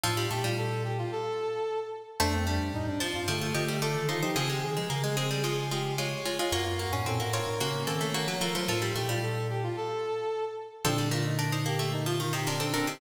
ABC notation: X:1
M:4/4
L:1/16
Q:1/4=111
K:Bb
V:1 name="Pizzicato Strings"
[Af]6 z10 | [ca]6 [ca]2 [Fd]2 [Ge]2 [Fd]2 [Ec] [Ec] | [C_A]6 [CA]2 [_A,F]2 [A,F]2 [A,F]2 [A,F] [A,F] | [F_d]6 [Fd]2 [B,_G]2 [CA]2 [B,G]2 [A,F] [A,F] |
[Af]6 z10 | [CA]2 [DB]2 [DB] [Ec]2 z4 [Ec] [DB] [CA] [DB] [Ec] |]
V:2 name="Brass Section"
F2 G F A2 G F A6 z2 | D C D2 E D F F A,2 A,2 A2 F G | _A G A2 B A c A A2 G2 _d2 d f | _G F G2 A G B B _D2 D2 _d2 B c |
F2 G F A2 G F A6 z2 | D2 F E z2 G2 E F F G D2 C2 |]
V:3 name="Pizzicato Strings"
F, G, A, G,11 z2 | A,2 G,4 F,2 F, F, F, G, A,4 | F, _A, z A, B, A, A, G, F,6 z2 | B,2 B, _D C B, C2 B,2 B, A, B, _G, B,2 |
F, G, A, G,11 z2 | F, G, A,2 D2 B, A, z F, E, C, C, z D, C, |]
V:4 name="Glockenspiel" clef=bass
A,,2 B,,6 z8 | F,,3 G,, A,, G,,2 G,, D,2 D,3 E, E, F, | _D,2 E, F, D,10 z2 | _G,,3 A,, B,, A,,2 A,, _D,2 E,3 F, F, _G, |
A,,2 B,,6 z8 | [B,,D,]16 |]